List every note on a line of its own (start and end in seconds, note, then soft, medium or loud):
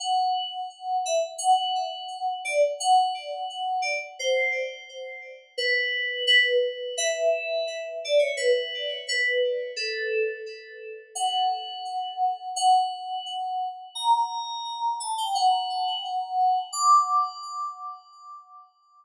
0.00 0.97 F#5 medium
1.06 1.22 E5 medium
1.38 2.33 F#5 medium
2.45 2.61 D5 medium
2.80 3.82 F#5 medium
3.82 3.98 D5 medium
4.19 4.83 C5 medium
5.58 6.23 B4 loud
6.27 6.95 B4 medium
6.98 7.89 E5 medium
8.05 8.21 D5 medium
8.19 8.35 C#5 medium
8.37 8.97 B4 medium
9.08 9.72 B4 medium
9.76 10.40 A4 medium
11.15 12.49 F#5 medium
12.56 13.68 F#5 medium
13.95 14.96 A#5 medium
15.00 15.17 A5 medium
15.18 15.34 G5 medium
15.35 16.59 F#5 loud
16.73 17.37 D6 medium